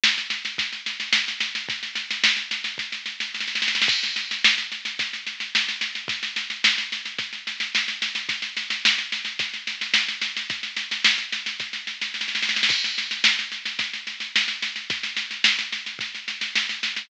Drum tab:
CC |------------------------|--------------------------------|x-------------------------------|--------------------------------|
SD |o-o-o-o-o-o-o-o-o-o-o-o-|o-o-o-o-o-o-o-o-o-o-o-o-oooooooo|o-o-o-o-o-o-o-o-o-o-o-o-o-o-o-o-|o-o-o-o-o-o-o-o-o-o-o-o-o-o-o-o-|
BD |--------o---------------|o---------------o---------------|o---------------o---------------|o---------------o---------------|

CC |--------------------------------|--------------------------------|x-------------------------------|--------------------------------|
SD |o-o-o-o-o-o-o-o-o-o-o-o-o-o-o-o-|o-o-o-o-o-o-o-o-o-o-o-o-oooooooo|o-o-o-o-o-o-o-o-o-o-o-o-o-o-o-o-|o-o-o-o-o-o-o-o-o-o-o-o-o-o-o-o-|
BD |o---------------o---------------|o---------------o---------------|o---------------o---------------|o---------------o---------------|